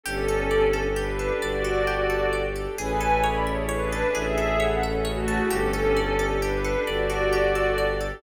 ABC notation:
X:1
M:6/8
L:1/8
Q:3/8=88
K:Amix
V:1 name="Pad 5 (bowed)"
[CA]4 [DB]2 | [Fd]4 z2 | [B^g]2 [db] [Ec] [DB]2 | [^Ge]2 [Af] [CA] [A,F]2 |
[CA]4 [DB]2 | [Fd]4 z2 |]
V:2 name="Orchestral Harp"
G A d A G A | d A G A d A | ^G A c e c A | ^G A c e c A |
G A d A G A | d A G A d A |]
V:3 name="String Ensemble 1"
[DGA]6- | [DGA]6 | [CE^GA]6- | [CE^GA]6 |
[DGA]6- | [DGA]6 |]
V:4 name="Violin" clef=bass
G,,,6 | G,,,6 | A,,,6 | A,,,6 |
G,,,6 | G,,,6 |]